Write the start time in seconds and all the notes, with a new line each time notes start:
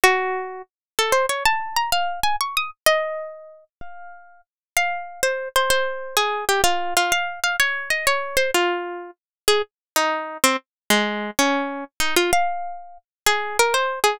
0.04 F#4
0.99 A4
1.12 C5
1.29 C#5
1.45 A5
1.76 A#5
1.92 F5
2.23 G#5
2.41 C#6
2.57 D#6
2.86 D#5
3.81 F5
4.77 F5
5.23 C5
5.56 C5
5.70 C5
6.17 G#4
6.49 G4
6.64 F4
6.97 F4
7.12 F5
7.44 F5
7.60 C#5
7.90 D#5
8.07 C#5
8.37 C5
8.54 F4
9.48 G#4
9.96 D#4
10.44 C4
10.90 G#3
11.39 C#4
12.00 D#4
12.16 F4
12.33 F5
13.26 G#4
13.59 A#4
13.74 C5
14.04 G#4